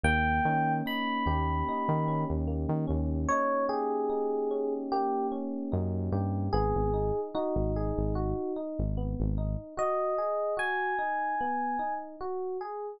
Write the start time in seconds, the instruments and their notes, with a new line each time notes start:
0.04 synth bass 1 D#2, electric piano 1 A#3 G5
0.45 synth bass 1 D#3, electric piano 1 C#4
0.86 electric piano 1 D#4 B5
1.26 synth bass 1 D#2, electric piano 1 G4
1.69 electric piano 1 D#4
1.89 synth bass 1 D#3
2.08 electric piano 1 C#4
2.30 synth bass 1 D#2
2.47 electric piano 1 A#3
2.69 synth bass 1 D#3
2.87 synth bass 1 D#2, electric piano 1 C#4
3.29 electric piano 1 D#4 C#5
3.69 electric piano 1 G4 G#4
4.10 electric piano 1 D#4
4.51 electric piano 1 C#4
4.92 electric piano 1 A#3 G4
5.32 electric piano 1 C#4
5.72 synth bass 1 F#2, electric piano 1 D#4
6.12 synth bass 1 G2, electric piano 1 G4
6.53 synth bass 1 G#1, electric piano 1 B3 G#4
6.75 synth bass 1 G#1
6.94 electric piano 1 D#4
7.34 electric piano 1 D#4 F#4
7.56 synth bass 1 G#1
7.76 electric piano 1 G#4
7.97 synth bass 1 G#1
8.15 electric piano 1 F#4
8.56 electric piano 1 D#4
8.79 synth bass 1 G#1
8.97 electric piano 1 B3
9.20 synth bass 1 G#1
9.38 electric piano 1 D#4
9.77 electric piano 1 F#4 D#5
10.18 electric piano 1 G#4
10.57 electric piano 1 F#4 G#5
10.98 electric piano 1 D#4
11.41 electric piano 1 B3
11.79 electric piano 1 D#4
12.21 electric piano 1 F#4
12.61 electric piano 1 G#4